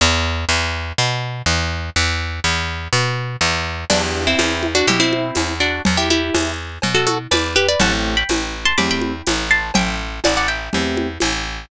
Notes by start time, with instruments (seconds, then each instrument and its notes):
0.01 electric bass (finger) E2
0.49 electric bass (finger) E2
0.98 electric bass (finger) B2
1.46 electric bass (finger) E2
1.96 electric bass (finger) E2
2.44 electric bass (finger) E2
2.93 electric bass (finger) B2
3.41 electric bass (finger) E2
3.90 electric bass (finger) E2, acoustic guitar (steel) B3 D4, acoustic grand piano B3 D4 E4 G4, crash, cowbell, low conga
4.27 acoustic guitar (steel) C4 E4
4.39 electric bass (finger) E2, tambourine, cowbell, high conga
4.63 high conga
4.75 acoustic guitar (steel) D4 F#4
4.87 electric bass (finger) B2, acoustic guitar (steel) E4 G4, cowbell, low conga
5.00 acoustic guitar (steel) C4 E4
5.13 high conga
5.35 electric bass (finger) E2, tambourine, cowbell, high conga
5.60 acoustic guitar (steel) D4 F#4
5.85 electric bass (finger) E2, cowbell, low conga
5.97 acoustic guitar (steel) E4 G4
6.10 acoustic guitar (steel) E4 G4, high conga
6.34 electric bass (finger) E2, tambourine, cowbell, high conga
6.82 electric bass (finger) B2, cowbell, low conga
6.95 acoustic guitar (steel) F#4 A4
7.07 acoustic guitar (steel) F#4 A4, high conga
7.31 electric bass (finger) E2, acoustic guitar (steel) B4 D5, tambourine, cowbell, high conga
7.56 acoustic guitar (steel) G4 B4
7.68 acoustic guitar (steel) B4 D5
7.80 electric bass (finger) A1, acoustic grand piano A3 C4 E4 G4, acoustic guitar (steel) F#5 A5, cowbell, low conga
8.17 acoustic guitar (steel) G5 B5
8.29 electric bass (finger) A1, tambourine, cowbell, high conga
8.65 acoustic guitar (steel) A5 C6
8.78 electric bass (finger) E2, acoustic grand piano A3 C4 E4 G4, acoustic guitar (steel) B5 D6, cowbell, low conga
8.91 acoustic guitar (steel) G5 B5
9.02 high conga
9.27 electric bass (finger) A1, tambourine, cowbell, high conga
9.51 acoustic guitar (steel) A5 C6
9.74 electric bass (finger) A1, acoustic guitar (steel) E5 G5, cowbell, low conga
10.24 electric bass (finger) A1, acoustic guitar (steel) D5 F#5, tambourine, cowbell, high conga
10.37 acoustic guitar (steel) D5 F#5
10.48 acoustic guitar (steel) E5 G5
10.73 electric bass (finger) E2, acoustic grand piano A3 C4 E4 G4, cowbell, low conga
10.97 high conga
11.20 electric bass (finger) A1, tambourine, cowbell, high conga